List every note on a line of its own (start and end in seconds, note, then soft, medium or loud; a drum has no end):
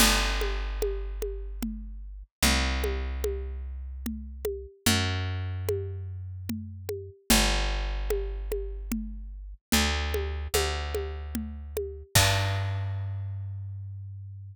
0.00 2.23 G1 loud
0.00 crash loud
0.00 low conga loud
0.41 high conga medium
0.82 high conga medium
1.22 high conga medium
1.63 low conga medium
2.43 4.66 C2 medium
2.43 low conga medium
2.84 high conga medium
3.24 high conga medium
4.06 low conga medium
4.45 high conga medium
4.86 7.10 F#2 loud
4.86 low conga loud
5.69 high conga medium
6.49 low conga medium
6.89 high conga medium
7.30 9.54 G1 loud
7.30 low conga loud
8.10 high conga medium
8.52 high conga medium
8.92 low conga medium
9.72 10.48 D2 medium
9.72 low conga loud
10.14 high conga medium
10.54 12.03 D2 medium
10.54 high conga medium
10.95 high conga medium
11.35 low conga medium
11.77 high conga medium
12.15 14.55 G2 loud
12.15 kick loud
12.15 crash loud